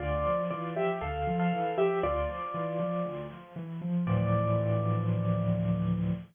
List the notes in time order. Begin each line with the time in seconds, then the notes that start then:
0.00 D2 F4 D5
0.26 F3
0.50 E3 F4 D5
0.76 F3 G4 E5
1.01 D2 A4 F5
1.27 F3
1.40 A4 F5
1.52 E3
1.78 F3 G4 E5
2.03 D2 F4 D5
2.29 F3
2.54 E3
2.80 F3
3.05 D2
3.31 F3
3.56 E3
3.81 F3
4.07 D2 A2 E3 F3 D5